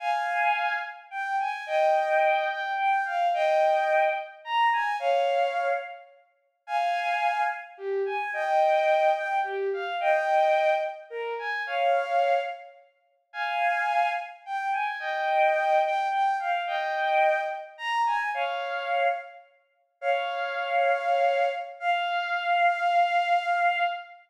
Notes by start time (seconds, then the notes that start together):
0.00 F5 G#5
1.11 G5
1.39 G#5
1.66 D#5 G5
2.50 G5
2.78 G5
3.05 F5
3.34 D#5 G5
4.45 A#5
4.73 G#5
4.99 C#5 F5
6.67 F5 G#5
7.78 G4
8.06 G#5
8.33 D#5 G5
9.16 G5
9.43 G4
9.73 F5
10.00 D#5 G5
11.10 A#4
11.39 G#5
11.66 C#5 F5
13.33 F5 G#5
14.46 G5
14.73 G#5
15.00 D#5 G5
15.84 G5
16.11 G5
16.39 F5
16.67 D#5 G5
17.78 A#5
18.06 G#5
18.34 C#5 F5
20.01 C#5 F5
21.80 F5